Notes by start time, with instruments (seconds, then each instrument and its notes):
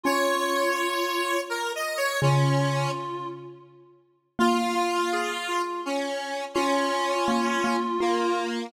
0.03 xylophone C#4, clarinet F4, lead 1 (square) C#5
1.50 lead 1 (square) A#4
1.75 lead 1 (square) D#5
1.97 lead 1 (square) C#5
2.22 xylophone C#3, lead 1 (square) C#4, clarinet F4
2.59 clarinet F4
4.39 xylophone A#3, lead 1 (square) F4, clarinet F4
4.58 clarinet F4
4.75 clarinet F4
5.13 clarinet G#4
5.48 clarinet F4
5.86 lead 1 (square) C#4
6.54 lead 1 (square) C#4, xylophone F4, clarinet F4
7.28 xylophone A#3
7.64 xylophone A#3
8.00 lead 1 (square) A#3, xylophone F4